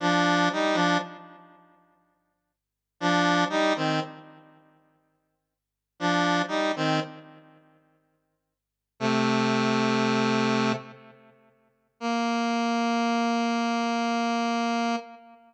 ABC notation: X:1
M:3/4
L:1/16
Q:1/4=60
K:Bb
V:1 name="Lead 1 (square)"
[F,D]2 [G,E] [F,D] z8 | [F,D]2 [G,E] [E,C] z8 | [F,D]2 [G,E] [E,C] z8 | [C,A,]8 z4 |
B,12 |]